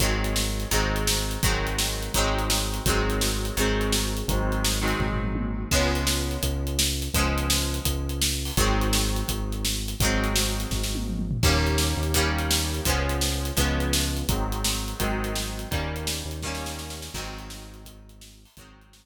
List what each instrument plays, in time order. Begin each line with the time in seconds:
0.00 synth bass 1 G#1, acoustic guitar (steel) D#3 F#3 G#3 C4, kick, closed hi-hat
0.24 closed hi-hat
0.36 snare
0.60 closed hi-hat
0.71 synth bass 1 G#1, acoustic guitar (steel) D#3 F#3 G#3 C4, kick, closed hi-hat
0.96 closed hi-hat
1.07 snare
1.31 closed hi-hat
1.43 synth bass 1 G#1, acoustic guitar (steel) D#3 F#3 G#3 C4, kick, closed hi-hat
1.67 closed hi-hat
1.78 snare
2.03 closed hi-hat
2.14 synth bass 1 G#1, acoustic guitar (steel) D#3 F#3 G#3, kick, closed hi-hat
2.18 acoustic guitar (steel) C4
2.39 closed hi-hat
2.50 snare
2.74 closed hi-hat
2.86 synth bass 1 G#1, acoustic guitar (steel) D#3 F#3 G#3, kick, closed hi-hat
2.90 acoustic guitar (steel) C4
3.10 closed hi-hat
3.21 snare
3.45 closed hi-hat
3.57 synth bass 1 G#1, acoustic guitar (steel) D#3 F#3 G#3 C4, kick, closed hi-hat
3.81 closed hi-hat
3.92 snare
4.17 closed hi-hat
4.28 synth bass 1 G#1, acoustic guitar (steel) D#3 F#3 G#3 C4, kick, closed hi-hat
4.52 closed hi-hat
4.65 snare
4.81 acoustic guitar (steel) D#3 F#3 G#3 C4
4.88 closed hi-hat
4.99 synth bass 1 G#1, kick, floor tom
5.12 floor tom
5.24 mid tom
5.35 high tom
5.71 synth bass 1 C#2, acoustic guitar (steel) F3 G#3 B3 C#4, kick, crash
5.95 closed hi-hat
6.07 snare
6.31 closed hi-hat
6.43 synth bass 1 C#2, kick, closed hi-hat
6.67 closed hi-hat
6.79 snare
7.02 closed hi-hat
7.14 synth bass 1 C#2, acoustic guitar (steel) F3 G#3 B3, kick, closed hi-hat
7.18 acoustic guitar (steel) C#4
7.38 closed hi-hat
7.50 snare
7.74 closed hi-hat
7.85 synth bass 1 C#2, kick, closed hi-hat
8.09 closed hi-hat
8.22 snare
8.45 open hi-hat
8.57 synth bass 1 G#1, acoustic guitar (steel) D#3 F#3 G#3 C4, kick, closed hi-hat
8.81 closed hi-hat
8.93 snare
9.16 closed hi-hat
9.28 synth bass 1 G#1, kick, closed hi-hat
9.52 closed hi-hat
9.65 snare
9.88 closed hi-hat
10.00 synth bass 1 G#1, acoustic guitar (steel) D#3 F#3 G#3, kick, closed hi-hat
10.05 acoustic guitar (steel) C4
10.24 closed hi-hat
10.36 snare
10.60 closed hi-hat
10.71 synth bass 1 G#1, kick, snare
10.83 snare
10.95 high tom
11.08 mid tom
11.19 mid tom
11.31 floor tom
11.43 synth bass 1 D#2, acoustic guitar (steel) D#3 G3 A#3, kick, crash
11.47 acoustic guitar (steel) C#4
11.67 closed hi-hat
11.78 snare
11.97 synth bass 1 D#2
12.03 closed hi-hat
12.14 acoustic guitar (steel) D#3 G3 A#3 C#4, kick, closed hi-hat
12.39 closed hi-hat
12.51 snare
12.74 closed hi-hat
12.85 synth bass 1 C#2, acoustic guitar (steel) F3 G#3 B3, kick, closed hi-hat
12.90 acoustic guitar (steel) C#4
13.09 closed hi-hat
13.21 snare
13.45 closed hi-hat
13.57 synth bass 1 C#2, acoustic guitar (steel) F3 G#3 B3 C#4, kick, closed hi-hat
13.80 closed hi-hat
13.93 snare
14.17 closed hi-hat
14.28 synth bass 1 G#1, acoustic guitar (steel) D#3 F#3 G#3, kick, closed hi-hat
14.32 acoustic guitar (steel) C4
14.52 closed hi-hat
14.64 snare
14.88 closed hi-hat
15.00 synth bass 1 G#1, acoustic guitar (steel) D#3 F#3 G#3 C4, kick, closed hi-hat
15.24 closed hi-hat
15.35 snare
15.59 closed hi-hat
15.71 synth bass 1 D#2, acoustic guitar (steel) D#3 G3 A#3 C#4, kick, closed hi-hat
15.96 closed hi-hat
16.07 snare
16.25 synth bass 1 D#2
16.31 closed hi-hat
16.42 acoustic guitar (steel) D#3 G3 A#3, kick, snare
16.47 acoustic guitar (steel) C#4
16.55 snare
16.66 snare
16.79 snare
16.90 snare
17.02 snare
17.14 synth bass 1 G#1, acoustic guitar (steel) D#3 F#3 G#3, kick, crash
17.18 acoustic guitar (steel) C4
17.39 closed hi-hat
17.50 snare
17.74 closed hi-hat
17.85 kick, closed hi-hat
18.09 closed hi-hat
18.21 snare
18.45 open hi-hat
18.57 synth bass 1 G#1, acoustic guitar (steel) D#3 F#3 G#3, kick, closed hi-hat
18.61 acoustic guitar (steel) C4
18.81 closed hi-hat
18.93 snare